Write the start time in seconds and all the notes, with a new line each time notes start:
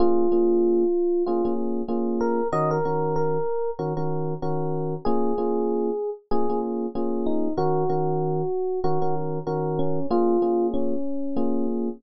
0.00 A#3 C#4 F4 G#4
0.32 A#3 C#4 F4 G#4
1.26 A#3 C#4 F4 G#4
1.45 A#3 C#4 F4 G#4
1.88 A#3 C#4 F4 G#4
2.21 A#4
2.52 D#3 C#4 F#4 A#4 D#5
2.71 A#4
2.85 D#3 C#4 F#4 A#4
3.16 A#4
3.79 D#3 C#4 F#4 A#4
3.97 D#3 C#4 F#4 A#4
4.42 D#3 C#4 F#4 A#4
5.05 A#3 C#4 F4 G#4
5.38 A#3 C#4 F4 G#4
6.31 A#3 C#4 F4 G#4
6.50 A#3 C#4 F4 G#4
6.95 A#3 C#4 F4 G#4
7.26 D#4
7.57 D#3 C#4 F#4 A#4
7.89 D#3 C#4 F#4 A#4
8.84 D#3 C#4 F#4 A#4
9.02 D#3 C#4 F#4 A#4
9.47 D#3 C#4 F#4 A#4
9.79 C#4
10.11 A#3 C#4 F4 G#4
10.42 A#3 C#4 F4 G#4
10.74 C#4
11.36 A#3 C#4 F4 G#4